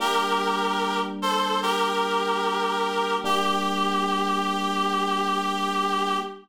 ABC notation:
X:1
M:4/4
L:1/8
Q:1/4=74
K:Gm
V:1 name="Clarinet"
[GB]3 [Ac] [GB]4 | G8 |]
V:2 name="Electric Piano 1"
[G,B,D]8 | [G,B,D]8 |]